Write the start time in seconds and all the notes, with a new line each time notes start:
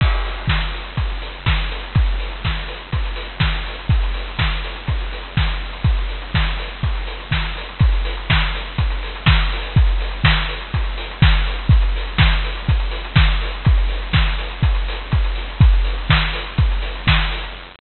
0.01 kick, crash
0.12 closed hi-hat
0.25 open hi-hat
0.37 closed hi-hat
0.47 kick, snare
0.60 closed hi-hat
0.73 open hi-hat
0.84 closed hi-hat
0.97 kick, closed hi-hat
1.10 closed hi-hat
1.22 open hi-hat
1.34 closed hi-hat
1.46 kick, snare
1.59 closed hi-hat
1.71 open hi-hat
1.83 closed hi-hat
1.95 kick, closed hi-hat
2.06 closed hi-hat
2.20 open hi-hat
2.31 closed hi-hat
2.45 kick, snare
2.56 closed hi-hat
2.68 open hi-hat
2.81 closed hi-hat
2.92 kick, closed hi-hat
3.06 closed hi-hat
3.16 open hi-hat
3.29 closed hi-hat
3.40 kick, snare
3.55 closed hi-hat
3.66 open hi-hat
3.79 closed hi-hat
3.89 kick, closed hi-hat
4.03 closed hi-hat
4.14 open hi-hat
4.28 closed hi-hat
4.39 kick, snare
4.51 closed hi-hat
4.64 open hi-hat
4.76 closed hi-hat
4.88 kick, closed hi-hat
5.00 closed hi-hat
5.13 open hi-hat
5.23 closed hi-hat
5.37 kick, snare
5.48 closed hi-hat
5.73 closed hi-hat
5.84 kick, closed hi-hat
5.97 closed hi-hat
6.09 open hi-hat
6.22 closed hi-hat
6.34 kick, snare
6.46 closed hi-hat
6.59 open hi-hat
6.70 closed hi-hat
6.83 kick, closed hi-hat
6.95 closed hi-hat
7.07 open hi-hat
7.20 closed hi-hat
7.31 kick, snare
7.44 closed hi-hat
7.57 open hi-hat
7.69 closed hi-hat
7.79 kick, closed hi-hat
7.92 closed hi-hat
8.05 open hi-hat
8.17 closed hi-hat
8.30 kick, snare
8.42 closed hi-hat
8.55 open hi-hat
8.66 closed hi-hat
8.78 kick, closed hi-hat
8.90 closed hi-hat
9.03 open hi-hat
9.15 closed hi-hat
9.26 kick, snare
9.38 closed hi-hat
9.52 open hi-hat
9.63 open hi-hat
9.76 kick, closed hi-hat
9.87 closed hi-hat
10.01 open hi-hat
10.11 closed hi-hat
10.24 kick, snare
10.37 closed hi-hat
10.49 open hi-hat
10.61 closed hi-hat
10.74 kick, closed hi-hat
10.84 closed hi-hat
10.98 open hi-hat
11.11 closed hi-hat
11.22 kick, snare
11.33 closed hi-hat
11.47 open hi-hat
11.59 closed hi-hat
11.69 kick, closed hi-hat
11.82 closed hi-hat
11.96 open hi-hat
12.07 closed hi-hat
12.18 kick, snare
12.32 closed hi-hat
12.44 open hi-hat
12.57 closed hi-hat
12.68 kick, closed hi-hat
12.80 closed hi-hat
12.91 open hi-hat
13.04 closed hi-hat
13.16 kick, snare
13.29 closed hi-hat
13.42 open hi-hat
13.53 closed hi-hat
13.65 kick, closed hi-hat
13.78 closed hi-hat
13.89 open hi-hat
14.02 closed hi-hat
14.13 kick, snare
14.26 closed hi-hat
14.38 open hi-hat
14.51 closed hi-hat
14.63 kick, closed hi-hat
14.75 closed hi-hat
14.88 open hi-hat
15.01 closed hi-hat
15.12 kick, closed hi-hat
15.24 closed hi-hat
15.36 open hi-hat
15.50 closed hi-hat
15.61 kick, closed hi-hat
15.73 closed hi-hat
15.84 open hi-hat
15.98 closed hi-hat
16.10 kick, snare
16.21 closed hi-hat
16.33 open hi-hat
16.46 closed hi-hat
16.58 kick, closed hi-hat
16.71 closed hi-hat
16.82 open hi-hat
16.95 closed hi-hat
17.07 kick, snare
17.19 closed hi-hat
17.31 open hi-hat
17.44 closed hi-hat